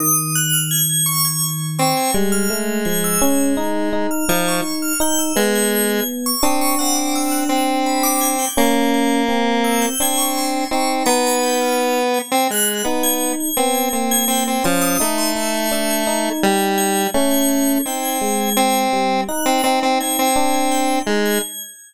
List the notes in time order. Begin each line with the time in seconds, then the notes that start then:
0.00 D#3 D#6
0.35 F#6
0.53 F6
0.71 G#6
0.89 G#6
1.06 C#6
1.25 G#6
1.78 C4 C#6
1.97 G#6
2.14 G3 G#3
2.32 F6
2.50 A3
2.85 F3 G#6
3.04 E6
3.22 C#4 G#6
3.57 D#4
3.93 D#4
4.11 F6
4.29 F3 D#4 G#6
4.48 C#6
4.82 F6
5.00 D#4 G6
5.19 E6
5.36 G#3 B3 G#6
5.55 G#6
5.71 G#6
5.89 G#6
6.26 C#6
6.42 C4 D4 D#6
6.61 C#6
6.79 C4 F#5
6.95 D6
7.15 E6
7.31 F#6
7.49 C4
7.86 B5
8.03 D6
8.21 G#6
8.39 G6
8.57 A#3 C#4 G#6
8.94 G#6
9.29 C4
9.64 E6
9.82 G6
10.00 C4 D4 G#6
10.18 C#6
10.37 C6
10.71 C4 D#4 C#6
11.06 B3 A#5
11.26 B5
11.43 G6
11.61 F6
12.14 G#6
12.32 C4 G#6
12.50 G#3 F#6
12.84 B3 D#4
13.03 G#6
13.40 G#6
13.57 B3 C4 G#6
13.74 G#6
13.93 A#3 C4
14.11 G#6
14.28 C4 G6
14.47 C4
14.64 F3 C#4 C6
14.81 D#6
15.00 A3 D#4 E6
15.18 C6
15.36 D#4 E6
15.54 G#6
15.71 D4 E6
15.90 G#6
16.07 D#4
16.43 G3 G#6
16.78 G#6
17.14 A3 C#4 G#6
17.31 G#6
17.48 G#6
17.68 G#6
17.86 C4 D#4 G6
18.02 G#6
18.21 G#3
18.41 G#6
18.57 C4 G#6
18.93 G3
19.28 D#4 F#6
19.46 C4
19.64 C4 D#4
19.83 C4
20.00 C4 G#6
20.19 C4
20.36 D4 G#6
20.54 G#6
20.71 G6
21.07 G#3 D#4
21.25 G#6